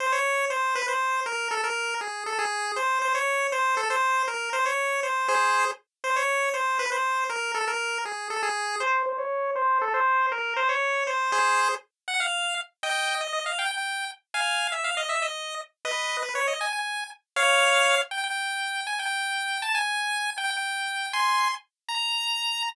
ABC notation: X:1
M:6/8
L:1/8
Q:3/8=159
K:Bbdor
V:1 name="Lead 1 (square)"
c d3 c2 | =B c3 _B2 | =A B3 ^G2 | =A _A3 c2 |
c d3 c2 | =A c3 B2 | c d3 c2 | [Ac]3 z3 |
c d3 c2 | =B c3 _B2 | =A B3 ^G2 | =A _A3 c2 |
c d3 c2 | =A c3 B2 | c d3 c2 | [Ac]3 z3 |
_g f3 z2 | [^dg]3 d d f | g g3 z2 | [fa]3 =e f _e |
=e _e3 z2 | [_ce]3 c d e | ^g g3 z2 | [df]5 z |
g g5 | a g5 | =a _a5 | g g5 |
[ac']3 z3 | b6 |]